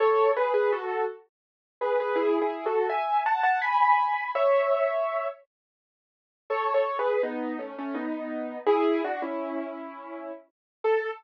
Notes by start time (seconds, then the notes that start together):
0.00 A4 C#5
0.37 G#4 B4
0.54 G#4 B4
0.72 F#4 A4
1.81 G#4 B4
2.00 G#4 B4
2.16 E4 G#4
2.42 E4 G#4
2.66 F#4 A4
2.89 E5 G#5
3.26 F#5 A5
3.43 F#5 A5
3.62 G#5 B5
4.35 C#5 E5
6.50 A4 C#5
6.74 A4 C#5
6.99 G#4 B4
7.23 B3 D#4
7.59 A3 C#4
7.78 A3 C#4
7.95 B3 D#4
8.67 E4 G#4
9.04 D4 F#4
9.22 C#4 E4
10.84 A4